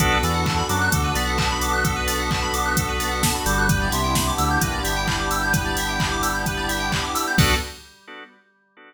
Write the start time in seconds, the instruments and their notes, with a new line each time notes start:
0.00 synth bass 2 B1, drawbar organ B3 D4 F#4 A4, pad 5 (bowed) B3 D4 F#4 A4, electric piano 2 A4, kick, closed hi-hat
0.12 electric piano 2 B4
0.23 synth bass 2 E2, drawbar organ E3, electric piano 2 D5, open hi-hat
0.34 electric piano 2 F#5
0.46 electric piano 2 A5, kick, clap
0.57 electric piano 2 B5
0.69 synth bass 2 F#2, drawbar organ F#3, electric piano 2 D6, open hi-hat
0.81 electric piano 2 F#6
0.92 synth bass 2 D2, drawbar organ D3, electric piano 2 A4, kick, closed hi-hat
1.04 electric piano 2 B4
1.15 synth bass 2 B1, drawbar organ B3, electric piano 2 D5, open hi-hat
1.27 electric piano 2 F#5
1.38 electric piano 2 A5, kick, clap
1.50 electric piano 2 B5
1.61 electric piano 2 D6, open hi-hat
1.73 electric piano 2 F#6
1.84 electric piano 2 A4, kick, closed hi-hat
1.96 electric piano 2 B4
2.07 electric piano 2 D5, open hi-hat
2.19 electric piano 2 F#5
2.31 electric piano 2 A5, kick, clap
2.42 electric piano 2 B5
2.54 electric piano 2 D6, open hi-hat
2.66 electric piano 2 F#6
2.77 electric piano 2 A4, kick, closed hi-hat
2.89 electric piano 2 B4
3.00 electric piano 2 D5, open hi-hat
3.11 electric piano 2 F#5
3.23 electric piano 2 A5, kick, snare
3.35 electric piano 2 B5
3.46 synth bass 2 G1, drawbar organ G3, electric piano 2 D6, open hi-hat
3.58 electric piano 2 F#6
3.69 pad 5 (bowed) B3 D4 E4 G4, electric piano 2 B4, kick, closed hi-hat
3.82 electric piano 2 D5
3.92 synth bass 2 C2, drawbar organ C3, electric piano 2 E5, open hi-hat
4.04 electric piano 2 G5
4.15 electric piano 2 B5, kick, snare
4.27 electric piano 2 D6
4.38 synth bass 2 D2, drawbar organ D3, electric piano 2 E6, open hi-hat
4.51 electric piano 2 G6
4.61 synth bass 2 A#1, drawbar organ A#3, electric piano 2 B4, kick, closed hi-hat
4.73 electric piano 2 D5
4.84 synth bass 2 G1, drawbar organ G3, electric piano 2 E5, open hi-hat
4.96 electric piano 2 G5
5.08 electric piano 2 B5, kick, clap
5.19 electric piano 2 D6
5.31 electric piano 2 E6, open hi-hat
5.43 electric piano 2 G6
5.53 electric piano 2 B4, kick, closed hi-hat
5.65 electric piano 2 D5
5.77 electric piano 2 E5, open hi-hat
5.89 electric piano 2 G5
6.00 electric piano 2 B5, kick, clap
6.12 electric piano 2 D6
6.23 electric piano 2 E6, open hi-hat
6.35 electric piano 2 G6
6.46 electric piano 2 B4, kick, closed hi-hat
6.57 electric piano 2 D5
6.69 electric piano 2 E5, open hi-hat
6.80 electric piano 2 G5
6.92 electric piano 2 B5, kick, clap
7.03 electric piano 2 D6
7.15 electric piano 2 E6, open hi-hat
7.27 electric piano 2 G6
7.38 synth bass 2 B1, drawbar organ B3 D4 F#4 A4, pad 5 (bowed) B3 D4 F#4 A4, electric piano 2 A4 B4 D5 F#5, kick, crash